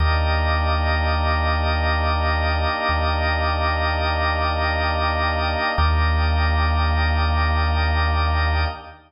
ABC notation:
X:1
M:4/4
L:1/8
Q:1/4=83
K:Eblyd
V:1 name="Choir Aahs"
[B,DEG]8- | [B,DEG]8 | [B,DEG]8 |]
V:2 name="Drawbar Organ"
[GBde]8- | [GBde]8 | [GBde]8 |]
V:3 name="Synth Bass 2" clef=bass
E,,8 | E,,8 | E,,8 |]